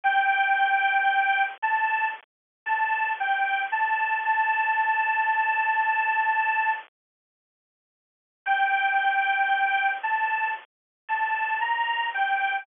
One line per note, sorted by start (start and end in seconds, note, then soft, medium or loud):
0.04 1.44 G5 loud
1.62 2.08 A5 loud
2.66 3.11 A5 loud
3.20 3.63 G5 loud
3.72 4.19 A5 loud
4.25 6.72 A5 loud
8.46 9.91 G5 loud
10.03 10.51 A5 loud
11.09 11.59 A5 loud
11.61 12.07 A#5 loud
12.14 12.64 G5 loud